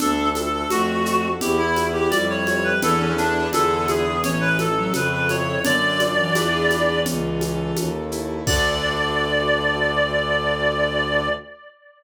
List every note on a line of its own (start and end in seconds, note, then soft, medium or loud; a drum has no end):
0.00 0.63 D2 loud
0.00 0.71 D4 loud
0.00 0.29 D4 loud
0.00 0.30 A4 loud
0.00 low conga loud
0.00 shaker medium
0.35 0.52 A4 medium
0.35 1.36 A4 medium
0.35 high conga medium
0.35 shaker medium
0.53 0.70 A4 medium
0.70 1.34 F2 medium
0.70 1.28 A3 loud
0.70 1.39 D4 medium
0.70 1.28 F#4 medium
0.70 high conga loud
0.70 shaker medium
1.06 1.40 F#4 medium
1.06 shaker medium
1.41 2.05 E2 loud
1.41 1.85 E4 loud
1.41 2.11 E4 medium
1.41 1.58 G4 medium
1.41 low conga loud
1.41 shaker loud
1.58 1.89 E4 medium
1.76 2.77 B4 medium
1.76 high conga medium
1.76 shaker medium
1.93 2.11 E4 loud
1.93 2.10 G4 medium
2.10 2.74 F2 loud
2.10 2.74 G3 loud
2.10 2.79 E4 medium
2.10 2.27 D5 loud
2.10 high conga loud
2.10 shaker medium
2.30 2.46 C#5 medium
2.47 2.81 G4 medium
2.47 2.64 C#5 medium
2.47 high conga medium
2.47 shaker medium
2.64 2.81 B4 medium
2.81 3.46 E2 loud
2.81 3.13 E3 loud
2.81 3.47 D4 loud
2.81 3.47 E4 loud
2.81 3.00 A4 loud
2.81 3.47 A4 loud
2.81 3.47 B4 loud
2.81 low conga loud
2.81 shaker medium
3.00 3.16 C#4 medium
3.18 3.49 D4 medium
3.18 shaker medium
3.53 4.19 E2 loud
3.53 4.19 D3 medium
3.53 4.17 D4 loud
3.53 4.17 E4 loud
3.53 4.17 G#4 loud
3.53 3.85 A4 loud
3.53 4.17 B4 loud
3.53 high conga loud
3.53 shaker medium
3.88 4.22 G#4 medium
3.88 high conga medium
3.88 shaker medium
4.23 4.87 A1 loud
4.23 4.67 E3 medium
4.23 4.92 C#4 loud
4.23 4.40 C#5 medium
4.23 low conga loud
4.23 shaker medium
4.41 4.57 B4 loud
4.59 5.60 A4 medium
4.59 4.93 A4 medium
4.59 high conga medium
4.59 shaker medium
4.77 4.93 F#3 medium
4.93 5.58 F2 loud
4.93 5.58 C#3 loud
4.93 5.60 C#4 medium
4.93 5.12 B4 medium
4.93 high conga medium
4.93 shaker medium
5.12 5.29 B4 medium
5.29 5.62 E4 medium
5.29 5.64 C#5 medium
5.29 high conga medium
5.29 shaker medium
5.64 6.29 F#2 loud
5.64 6.12 D3 loud
5.64 6.32 D4 loud
5.64 6.99 D5 loud
5.64 low conga loud
5.64 shaker loud
6.00 6.34 F#4 medium
6.00 high conga medium
6.00 shaker medium
6.18 7.91 E3 medium
6.35 7.01 E2 loud
6.35 6.99 D4 loud
6.35 6.99 E4 loud
6.35 6.99 G#4 medium
6.35 6.99 B4 loud
6.35 high conga loud
6.35 shaker loud
6.70 high conga medium
6.70 shaker medium
7.05 7.70 C#2 loud
7.05 7.76 C#4 loud
7.05 low conga loud
7.05 shaker loud
7.41 8.41 A4 medium
7.41 high conga medium
7.41 shaker medium
7.76 8.40 D#2 loud
7.76 8.44 C#4 medium
7.76 high conga loud
7.76 shaker medium
8.12 8.45 E4 medium
8.12 shaker medium
8.46 11.28 D2 loud
8.46 11.29 D3 loud
8.46 11.29 D4 loud
8.46 11.29 F#4 loud
8.46 11.29 A4 loud
8.46 11.28 D5 loud
8.46 kick loud
8.46 crash loud